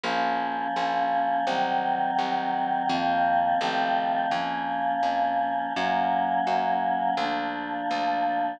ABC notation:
X:1
M:4/4
L:1/8
Q:1/4=84
K:Bbm
V:1 name="Choir Aahs"
[F,B,D]4 [E,G,C]4 | [E,F,B,C]2 [E,F,=A,C]2 [F,B,D]4 | [G,B,D]4 [F,B,=D]4 |]
V:2 name="Electric Bass (finger)" clef=bass
B,,,2 B,,,2 C,,2 C,,2 | F,,2 =A,,,2 F,,2 F,,2 | G,,2 G,,2 =D,,2 D,,2 |]